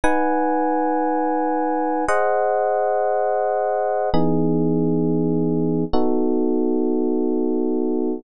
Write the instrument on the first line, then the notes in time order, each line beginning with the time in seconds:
electric piano 1
0.04 D#4 B4 F#5 G#5
2.08 G#4 C5 D#5 F#5
4.14 E3 B3 D#4 G#4
5.93 B3 D#4 F#4 A4